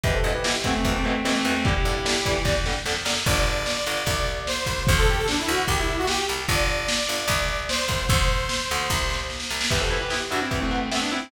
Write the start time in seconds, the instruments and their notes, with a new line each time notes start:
0.03 electric bass (finger) E2, overdriven guitar B2 E3, distortion guitar G4 B4, kick, closed hi-hat
0.14 distortion guitar A4 C5
0.24 electric bass (finger) G2, overdriven guitar B2 E3, closed hi-hat
0.34 distortion guitar G4 B4
0.44 overdriven guitar B2 E3, distortion guitar E4 G4, snare
0.64 overdriven guitar B2 E3, electric bass (finger) E3, distortion guitar A3 C4, kick, closed hi-hat
0.74 distortion guitar A3 C4
0.85 electric bass (finger) E2, overdriven guitar B2 E3, kick, closed hi-hat
0.95 distortion guitar A3 C4
1.04 overdriven guitar B2 E3, distortion guitar A3 C4, closed hi-hat
1.25 overdriven guitar B2 E3, electric bass (finger) E3, distortion guitar A3 C4, snare
1.35 distortion guitar A3 C4
1.44 electric bass (finger) E2, overdriven guitar B2 E3, distortion guitar A3 C4, closed hi-hat
1.65 overdriven guitar D3 G3, distortion guitar E4 G4, kick, closed hi-hat
1.85 electric bass (finger) G2, overdriven guitar D3 G3, closed hi-hat
2.05 overdriven guitar D3 G3, snare
2.25 overdriven guitar D3 G3, electric bass (finger) E3, kick, closed hi-hat
2.45 electric bass (finger) E2, overdriven guitar D3 G3, kick, snare
2.65 overdriven guitar D3 G3, snare
2.85 electric bass (finger) F2, overdriven guitar D3 G3, snare
3.05 electric bass (finger) F#2, overdriven guitar D3 G3, snare
3.26 electric bass (finger) G1, lead 2 (sawtooth) D5, kick, crash
3.36 closed hi-hat
3.47 closed hi-hat
3.57 closed hi-hat
3.66 snare
3.76 closed hi-hat
3.86 electric bass (finger) G1, closed hi-hat
3.97 closed hi-hat
4.06 electric bass (finger) C2, kick, closed hi-hat
4.16 closed hi-hat
4.27 closed hi-hat
4.37 closed hi-hat
4.47 lead 2 (sawtooth) C5, snare
4.57 closed hi-hat
4.66 electric bass (finger) C2, kick, closed hi-hat
4.76 open hi-hat
4.87 electric bass (finger) D2, lead 2 (sawtooth) C5, kick, closed hi-hat
4.97 lead 2 (sawtooth) A4, closed hi-hat
5.07 lead 2 (sawtooth) G4, closed hi-hat
5.17 lead 2 (sawtooth) A4, closed hi-hat
5.28 lead 2 (sawtooth) D4, snare
5.37 lead 2 (sawtooth) E4, closed hi-hat
5.48 electric bass (finger) D2, lead 2 (sawtooth) F#4, closed hi-hat
5.58 closed hi-hat
5.67 electric bass (finger) C2, lead 2 (sawtooth) G4, kick, closed hi-hat
5.77 lead 2 (sawtooth) E4, closed hi-hat
5.88 closed hi-hat
5.98 lead 2 (sawtooth) F#4, closed hi-hat
6.07 lead 2 (sawtooth) G4, snare
6.19 closed hi-hat
6.29 electric bass (finger) C2, closed hi-hat
6.38 closed hi-hat
6.48 electric bass (finger) G1, lead 2 (sawtooth) D5, kick, closed hi-hat
6.58 closed hi-hat
6.68 closed hi-hat
6.79 closed hi-hat
6.88 snare
6.99 closed hi-hat
7.09 electric bass (finger) G1, closed hi-hat
7.18 closed hi-hat
7.28 electric bass (finger) C2, kick, closed hi-hat
7.39 closed hi-hat
7.48 closed hi-hat
7.59 closed hi-hat
7.69 lead 2 (sawtooth) C5, snare
7.79 closed hi-hat
7.88 electric bass (finger) C2, kick, closed hi-hat
7.99 closed hi-hat
8.09 electric bass (finger) D2, lead 2 (sawtooth) C5, kick, closed hi-hat
8.20 closed hi-hat
8.29 closed hi-hat
8.39 closed hi-hat
8.49 snare
8.60 closed hi-hat
8.69 electric bass (finger) D2, closed hi-hat
8.79 closed hi-hat
8.89 electric bass (finger) C2, kick, snare
9.10 snare
9.30 snare
9.40 snare
9.50 electric bass (finger) C2, snare
9.61 snare
9.70 electric bass (finger) E2, overdriven guitar B3 E4, distortion guitar G4 B4, kick, crash
9.80 distortion guitar A4 C5
9.90 overdriven guitar B3 E4, closed hi-hat
10.01 distortion guitar G4 B4
10.10 overdriven guitar B3 E4, distortion guitar E4 G4, snare
10.31 electric bass (finger) G2, overdriven guitar B3 E4, distortion guitar D4 F#4, closed hi-hat
10.41 distortion guitar C4 E4
10.51 electric bass (finger) E2, overdriven guitar B3 E4, kick, closed hi-hat
10.61 distortion guitar A3 C4
10.71 distortion guitar A3 C4, overdriven guitar B3 E4, closed hi-hat
10.91 distortion guitar A3 C4, overdriven guitar B3 E4, snare
11.01 distortion guitar B3 D4
11.11 overdriven guitar B3 E4, distortion guitar C4 E4, closed hi-hat